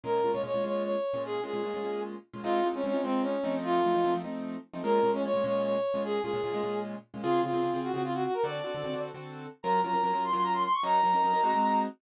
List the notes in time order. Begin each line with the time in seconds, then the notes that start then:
0.04 A#2 G#3 C#4 F4 A#4
0.24 A#2 G#3 C#4 F4
0.32 A#2 G#3 C#4 F4 C#5
0.44 A#2 G#3 C#4 F4 C#5
0.54 A#2 G#3 C#4 F4
0.64 A#2 G#3 C#4 F4 C#5
0.83 C#5
1.14 A#2 G#3 C#4 F4
1.25 G#4
1.44 A#2 G#3 C#4 F4 G#4
1.54 A#2 G#3 C#4 F4
1.63 A#2 G#3 C#4 F4
1.74 A#2 G#3 C#4 F4
1.83 A#2 G#3 C#4 F4
2.33 A#2 G#3 C#4 F4
2.43 G#3 C4 D#4 F4
2.64 G#3 C4 D#4 F4
2.73 G#3 C4 C#4 D#4 F4
2.84 G#3 C4 C#4 D#4 F4
2.93 G#3 C4 D#4 F4
3.03 G#3 C4 D#4 F4
3.22 C#4
3.44 F3 A3 C4 D#4
3.64 F4
3.84 F3 A3 C4 D#4
3.94 F3 A3 C4 D#4
4.04 F3 A3 C4 D#4
4.14 F3 A3 C4 D#4
4.24 F3 A3 C4 D#4
4.74 F3 A3 C4 D#4
4.83 A#2 G#3 C#4 F4 A#4
5.03 A#2 G#3 C#4 F4
5.13 A#2 G#3 C#4 F4
5.23 A#2 G#3 C#4 F4 C#5
5.34 A#2 G#3 C#4 F4
5.44 A#2 G#3 C#4 F4 C#5
5.63 C#5
5.94 A#2 G#3 C#4 F4
6.04 G#4
6.22 A#2 G#3 C#4 F4 G#4
6.33 A#2 G#3 C#4 F4
6.44 A#2 G#3 C#4 F4
6.53 A#2 G#3 C#4 F4
6.63 A#2 G#3 C#4 F4
7.14 A#2 G#3 C#4 F4
7.23 C#3 C4 F4 G#4
7.43 C#3 C4 F4 G#4
7.53 C#3 C4 F4 G#4
7.63 C#3 C4 F4 G#4
7.74 C#3 C4 F4 G#4
7.84 F#4
7.93 C#3 C4 F4 F#4 G#4
8.04 F4
8.14 F#4
8.25 F#4
8.34 A#4
8.44 D3 C4 F#4 A4 D5
8.64 D3 C4 F#4 A4
8.75 D3 C4 F#4 A4
8.84 D3 C4 F#4 A4
8.93 D3 C4 F#4 A4
9.14 D3 C4 F#4 A4
9.63 F#3 C#4 F4 A#4 A#5
9.84 F#3 C#4 F4 A#4 A#5
9.93 F#3 C#4 F4 A#4
10.04 F#3 C#4 F4 A#4
10.13 F#3 C#4 F4 A#4
10.24 C6
10.33 F#3 C#4 F4 A#4 C6
10.43 A#5
10.53 C6
10.63 C6
10.73 C#6
10.83 F#3 C#4 D#4 A#4 A#5
11.03 F#3 C#4 D#4 A#4
11.13 F#3 C#4 D#4 A#4
11.24 F#3 C#4 D#4 A#4
11.33 F#3 C#4 D#4 A#4
11.44 G#3 C4 D#4 F#4
11.54 G#3 C4 D#4 F#4